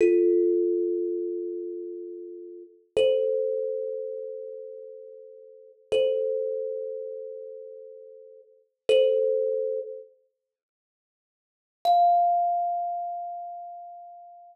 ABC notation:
X:1
M:4/4
L:1/8
Q:1/4=81
K:Fmix
V:1 name="Kalimba"
[FA]8 | [Ac]8 | [Ac]8 | [Ac]3 z5 |
f8 |]